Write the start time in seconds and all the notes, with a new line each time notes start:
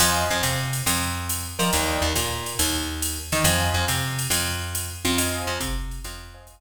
0.00 F2 C5 D#5 F5 G#5, crash, ride
0.30 F2
0.43 C3, hi-hat pedal, ride
0.73 ride
0.86 F2, ride
1.29 hi-hat pedal, ride
1.59 F3 A#4 D5 D#5 G5, ride
1.73 D#2, ride
2.02 D#2
2.16 A#2, hi-hat pedal, ride
2.46 ride
2.59 D#2, ride
3.02 hi-hat pedal, ride
3.32 D#3 A#4 D5 D#5 G5, ride
3.44 F2 C5 D#5 F5 G#5, ride
3.74 F2
3.88 C3, hi-hat pedal, ride
4.19 ride
4.30 F2, ride
4.75 hi-hat pedal, ride
5.05 F2, ride
5.18 C5 D#5 F5 G#5, ride
5.47 F2
5.60 C3, kick, hi-hat pedal, ride
5.91 ride
6.04 F2, ride
6.34 C5 D#5 F5 G#5
6.47 kick, hi-hat pedal, ride